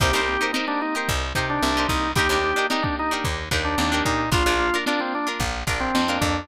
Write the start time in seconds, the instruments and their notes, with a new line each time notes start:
0.00 electric bass (finger) C2, drawbar organ A#3 C4 D#4 G4, acoustic guitar (steel) D#4 G4 A#4 C5, kick, closed hi-hat
0.13 electric bass (finger) C2, acoustic guitar (steel) D#4 G4 A#4 C5, closed hi-hat
0.27 drawbar organ A#3 C4 D#4 G4, snare, closed hi-hat
0.40 acoustic guitar (steel) D#4 G4 A#4 C5, snare, closed hi-hat
0.53 drawbar organ D#4, acoustic guitar (steel) D#4 G4 A#4 C5, snare
0.68 drawbar organ A#3 C4 D4 D#4 G4, closed hi-hat
0.81 drawbar organ D#4, closed hi-hat
0.94 acoustic guitar (steel) D#4 G4 A#4 C5, closed hi-hat
1.08 electric bass (finger) C2, kick, closed hi-hat
1.21 closed hi-hat
1.35 electric bass (finger) C3, acoustic guitar (steel) D#4 G4 A#4 C5, kick, closed hi-hat
1.49 drawbar organ D4, closed hi-hat
1.62 electric bass (finger) C2, drawbar organ A#3 C4 D#4 G4, snare
1.76 drawbar organ A#3 C4 D#4 G4, acoustic guitar (steel) D#4 G4 A#4 C5, closed hi-hat
1.89 electric bass (finger) C2, drawbar organ D#4, kick, closed hi-hat
2.03 closed hi-hat
2.15 electric bass (finger) D#2, drawbar organ A#3 D4 D#4 G4, acoustic guitar (steel) D4 D#4 G4 A#4, kick, closed hi-hat
2.29 electric bass (finger) D#2, acoustic guitar (steel) D4 D#4 G4 A#4, snare, closed hi-hat
2.43 drawbar organ A#3 D4 D#4 G4, closed hi-hat
2.56 acoustic guitar (steel) D4 D#4 G4 A#4, closed hi-hat
2.70 acoustic guitar (steel) D4 D#4 G4 A#4, drawbar organ D#4, snare
2.83 drawbar organ A#3 D4 D#4 G4, kick, closed hi-hat
2.97 drawbar organ D#4, closed hi-hat
3.11 acoustic guitar (steel) D4 D#4 G4 A#4
3.24 electric bass (finger) D#2, kick, closed hi-hat
3.38 closed hi-hat
3.51 electric bass (finger) D#2, acoustic guitar (steel) D4 D#4 G4 A#4, kick, closed hi-hat
3.65 drawbar organ D4, closed hi-hat
3.78 electric bass (finger) D#2, drawbar organ A#3 D4 D#4 G4, snare
3.92 drawbar organ A#3 D4 D#4 G4, acoustic guitar (steel) D4 D#4 G4 A#4, snare, closed hi-hat
4.05 electric bass (finger) A#2, drawbar organ D#4, kick, closed hi-hat
4.18 snare, closed hi-hat
4.32 electric bass (finger) A#1, drawbar organ A#3 D4 F4, acoustic guitar (steel) D4 F4 A#4, kick, closed hi-hat
4.46 electric bass (finger) A#1, acoustic guitar (steel) D4 F4 A#4, closed hi-hat
4.59 drawbar organ A#3 D4 F4, closed hi-hat
4.73 acoustic guitar (steel) D4 F4 A#4, closed hi-hat
4.86 acoustic guitar (steel) D4 F4 A#4, drawbar organ D4, snare
4.99 drawbar organ A#3 C4 D4 F4, closed hi-hat
5.13 drawbar organ D4, closed hi-hat
5.27 acoustic guitar (steel) D4 F4 A#4, snare, closed hi-hat
5.40 electric bass (finger) A#1, kick, closed hi-hat
5.54 closed hi-hat
5.67 electric bass (finger) A#1, acoustic guitar (steel) D4 F4 A#4, kick, snare, closed hi-hat
5.80 drawbar organ C4, closed hi-hat
5.95 electric bass (finger) F2, drawbar organ A#3 D4 F4, snare
6.08 drawbar organ A#3 D4 F4, acoustic guitar (steel) D4 F4 A#4, snare, closed hi-hat
6.21 electric bass (finger) F2, drawbar organ D4, kick, closed hi-hat
6.35 closed hi-hat